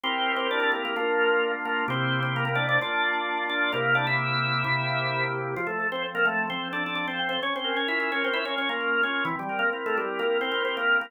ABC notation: X:1
M:4/4
L:1/16
Q:1/4=130
K:F
V:1 name="Drawbar Organ"
[Cc]3 [Cc] [Dd] [Dd] [B,B] [B,B] [B,B]6 [B,B]2 | [Cc]3 [Cc] [B,B] [B,B] [Dd] [Dd] [Dd]6 [Dd]2 | [B,B]2 [Dd] [Ee]11 z2 | [F,F] [A,A]2 [Cc] z [B,B] [A,A]2 [Cc]2 [Dd] [Dd] [Dd] [Cc]2 [Cc] |
[_D_d] [Cc]2 [Dd] [Ee] [Ee] [Dd] [Cc] [Ee] [Dd] [Dd] [B,B]3 [Dd]2 | [E,E] [G,G]2 [B,B] z [A,A] [G,G]2 [B,B]2 [Cc] [Cc] [Cc] [B,B]2 [B,B] |]
V:2 name="Drawbar Organ"
[CEGB]8 [B,DF]8 | [C,B,EG]8 [B,DF]8 | [C,B,EG]8 [C,B,EG]8 | F,2 A2 C2 z2 F,2 A2 A2 C2 |
_D2 B2 F2 B2 D2 B2 B2 F2 | C2 B2 E2 z2 C2 B2 G2 E2 |]